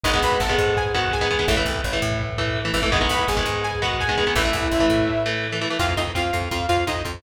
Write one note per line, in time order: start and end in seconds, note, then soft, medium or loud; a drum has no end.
0.03 0.20 G#1 medium
0.03 0.11 D#3 loud
0.03 0.11 G#3 loud
0.03 0.11 B3 loud
0.03 0.20 D#4 medium
0.03 0.20 D#5 medium
0.03 kick loud
0.03 crash loud
0.13 0.42 D#3 medium
0.13 0.42 G#3 loud
0.13 0.42 B3 loud
0.13 kick loud
0.13 closed hi-hat medium
0.22 0.38 B1 medium
0.22 0.39 B4 medium
0.22 0.39 B5 medium
0.22 kick medium
0.22 closed hi-hat medium
0.32 kick medium
0.32 closed hi-hat medium
0.40 0.55 G#1 medium
0.40 0.75 A4 medium
0.40 0.75 A5 medium
0.40 kick loud
0.40 snare loud
0.49 0.78 D#3 medium
0.49 0.78 G#3 loud
0.49 0.78 B3 loud
0.49 kick medium
0.49 closed hi-hat medium
0.57 1.35 G#2 medium
0.57 kick loud
0.57 closed hi-hat medium
0.66 kick medium
0.66 closed hi-hat medium
0.76 0.92 G#4 medium
0.76 0.92 G#5 medium
0.76 kick loud
0.76 closed hi-hat loud
0.85 kick medium
0.85 closed hi-hat medium
0.94 1.16 D#3 loud
0.94 1.16 G#3 medium
0.94 1.16 B3 loud
0.94 1.10 F#4 medium
0.94 1.10 F#5 medium
0.94 kick medium
0.94 closed hi-hat medium
1.03 kick medium
1.03 closed hi-hat medium
1.11 1.47 G#4 medium
1.11 1.47 G#5 medium
1.11 kick loud
1.11 snare loud
1.20 1.28 D#3 loud
1.20 1.28 G#3 loud
1.20 1.28 B3 loud
1.20 kick medium
1.20 closed hi-hat medium
1.31 1.38 D#3 medium
1.31 1.38 G#3 loud
1.31 1.38 B3 medium
1.31 kick medium
1.31 closed hi-hat medium
1.39 1.46 D#3 medium
1.39 1.46 G#3 medium
1.39 1.46 B3 loud
1.39 kick medium
1.39 closed hi-hat medium
1.48 1.63 A1 medium
1.48 1.55 E3 loud
1.48 1.55 A3 loud
1.48 kick loud
1.48 closed hi-hat loud
1.57 1.86 E3 loud
1.57 1.86 A3 medium
1.57 kick loud
1.57 closed hi-hat medium
1.65 1.81 C2 medium
1.65 kick medium
1.65 closed hi-hat medium
1.75 kick medium
1.75 closed hi-hat medium
1.84 1.99 A1 medium
1.84 kick medium
1.84 snare loud
1.93 2.22 E3 loud
1.93 2.22 A3 loud
1.93 kick medium
1.93 closed hi-hat medium
2.01 2.70 A2 medium
2.01 kick medium
2.01 closed hi-hat medium
2.10 kick medium
2.10 closed hi-hat medium
2.20 kick medium
2.20 closed hi-hat loud
2.28 kick medium
2.28 closed hi-hat medium
2.38 2.60 E3 loud
2.38 2.60 A3 medium
2.38 kick loud
2.38 closed hi-hat medium
2.46 kick medium
2.46 closed hi-hat medium
2.55 kick medium
2.55 snare loud
2.65 2.72 E3 loud
2.65 2.72 A3 medium
2.65 closed hi-hat medium
2.74 3.07 G#1 medium
2.74 2.81 E3 medium
2.74 2.81 A3 loud
2.74 kick medium
2.74 closed hi-hat medium
2.82 2.90 E3 loud
2.82 2.90 A3 loud
2.82 kick loud
2.82 closed hi-hat medium
2.91 2.99 D#3 loud
2.91 2.99 G#3 loud
2.91 2.99 B3 loud
2.91 3.08 D#4 medium
2.91 3.08 D#5 medium
2.91 kick loud
2.91 closed hi-hat loud
3.01 3.30 D#3 loud
3.01 3.30 G#3 medium
3.01 3.30 B3 loud
3.01 kick medium
3.01 closed hi-hat medium
3.09 3.25 B1 medium
3.09 3.27 B4 medium
3.09 3.27 B5 medium
3.09 kick medium
3.09 closed hi-hat medium
3.19 kick medium
3.19 closed hi-hat medium
3.27 3.43 G#1 medium
3.27 3.59 G#4 medium
3.27 3.59 G#5 medium
3.27 kick medium
3.27 snare loud
3.37 3.65 D#3 loud
3.37 3.65 G#3 medium
3.37 3.65 B3 medium
3.37 kick loud
3.37 closed hi-hat medium
3.46 4.22 G#2 medium
3.46 kick medium
3.46 closed hi-hat medium
3.54 kick medium
3.54 closed hi-hat medium
3.63 3.79 G#4 medium
3.63 3.79 G#5 medium
3.63 closed hi-hat loud
3.72 kick medium
3.72 closed hi-hat medium
3.81 4.04 D#3 loud
3.81 4.04 G#3 medium
3.81 4.04 B3 loud
3.81 3.97 F#4 medium
3.81 3.97 F#5 medium
3.81 kick medium
3.81 closed hi-hat medium
3.90 kick medium
3.90 closed hi-hat medium
3.99 4.32 G#4 medium
3.99 4.32 G#5 medium
3.99 kick loud
3.99 snare loud
4.08 4.16 D#3 medium
4.08 4.16 G#3 loud
4.08 4.16 B3 medium
4.08 kick medium
4.08 closed hi-hat medium
4.17 4.25 D#3 medium
4.17 4.25 G#3 loud
4.17 4.25 B3 medium
4.17 kick medium
4.17 closed hi-hat medium
4.26 4.34 D#3 medium
4.26 4.34 G#3 medium
4.26 4.34 B3 medium
4.26 kick medium
4.26 closed hi-hat medium
4.35 4.51 A1 medium
4.35 4.43 E3 loud
4.35 4.43 A3 loud
4.35 5.23 E4 medium
4.35 5.23 E5 medium
4.35 kick loud
4.35 closed hi-hat loud
4.44 4.74 E3 loud
4.44 4.74 A3 loud
4.44 kick medium
4.44 closed hi-hat medium
4.53 4.68 C2 medium
4.53 kick loud
4.53 closed hi-hat medium
4.62 kick loud
4.62 closed hi-hat medium
4.71 4.87 A1 medium
4.71 kick medium
4.71 snare loud
4.79 5.09 E3 loud
4.79 5.09 A3 loud
4.79 kick medium
4.79 closed hi-hat medium
4.89 5.66 A2 medium
4.89 kick medium
4.89 closed hi-hat medium
4.98 kick medium
4.98 closed hi-hat medium
5.07 kick medium
5.07 snare medium
5.25 5.47 E3 loud
5.25 5.47 A3 loud
5.25 snare medium
5.44 snare loud
5.52 5.60 E3 medium
5.52 5.60 A3 medium
5.61 5.69 E3 medium
5.61 5.69 A3 loud
5.61 snare loud
5.70 5.78 E3 medium
5.70 5.78 A3 medium
5.79 5.95 F2 medium
5.79 5.86 C4 medium
5.79 5.86 F4 medium
5.79 5.94 F4 medium
5.79 5.94 F5 loud
5.79 kick loud
5.79 crash loud
5.89 kick medium
5.97 6.12 F2 medium
5.97 6.04 C4 medium
5.97 6.12 D#4 medium
5.97 6.04 F4 medium
5.97 6.12 D#5 medium
5.97 kick medium
5.97 closed hi-hat medium
6.07 kick medium
6.15 6.31 F2 medium
6.15 6.22 C4 medium
6.15 6.22 F4 medium
6.15 6.49 F4 medium
6.15 6.49 F5 medium
6.15 kick medium
6.15 snare loud
6.24 kick medium
6.33 6.49 F2 medium
6.33 6.40 C4 medium
6.33 6.40 F4 medium
6.33 kick medium
6.33 closed hi-hat medium
6.42 kick medium
6.51 6.67 F2 medium
6.51 6.59 C4 medium
6.51 6.66 F4 medium
6.51 6.59 F4 medium
6.51 6.66 F5 medium
6.51 kick medium
6.51 closed hi-hat loud
6.60 kick medium
6.68 6.84 F2 medium
6.68 6.76 C4 medium
6.68 6.85 F4 medium
6.68 6.76 F4 medium
6.68 6.85 F5 medium
6.68 kick medium
6.68 closed hi-hat medium
6.77 kick medium
6.87 7.03 F2 medium
6.87 6.94 C4 medium
6.87 7.04 D#4 medium
6.87 6.94 F4 medium
6.87 7.04 D#5 medium
6.87 kick medium
6.87 snare loud
6.95 kick medium
7.04 7.21 F2 medium
7.04 7.12 C4 medium
7.04 7.12 F4 medium
7.04 kick medium
7.04 closed hi-hat medium
7.14 kick medium